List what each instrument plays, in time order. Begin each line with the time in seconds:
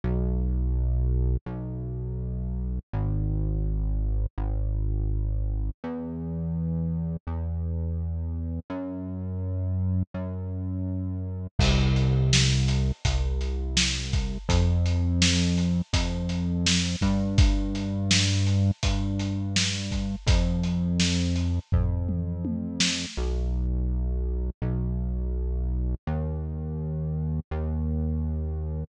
0.04 synth bass 1 B1
1.46 synth bass 1 B1
2.93 synth bass 1 G#1
4.38 synth bass 1 G#1
5.84 synth bass 1 E2
7.27 synth bass 1 E2
8.70 synth bass 1 F#2
10.14 synth bass 1 F#2
11.59 synth bass 1 C2, kick, crash
11.96 closed hi-hat
12.33 snare
12.68 closed hi-hat
13.05 synth bass 1 C2, kick, closed hi-hat
13.41 closed hi-hat
13.77 snare
14.13 kick, closed hi-hat
14.49 synth bass 1 F2, kick, closed hi-hat
14.86 closed hi-hat
15.22 snare
15.58 closed hi-hat
15.93 synth bass 1 F2, kick, closed hi-hat
16.29 closed hi-hat
16.66 snare
17.01 synth bass 1 G2, kick, closed hi-hat
17.38 kick, closed hi-hat
17.75 closed hi-hat
18.11 snare
18.47 closed hi-hat
18.83 synth bass 1 G2, kick, closed hi-hat
19.19 closed hi-hat
19.56 snare
19.91 kick, closed hi-hat
20.27 synth bass 1 F2, kick, closed hi-hat
20.63 closed hi-hat
21.00 snare
21.36 closed hi-hat
21.72 synth bass 1 F2, kick, floor tom
22.09 mid tom
22.45 high tom
22.80 snare
23.17 synth bass 1 B1
24.62 synth bass 1 B1
26.07 synth bass 1 D#2
27.51 synth bass 1 D#2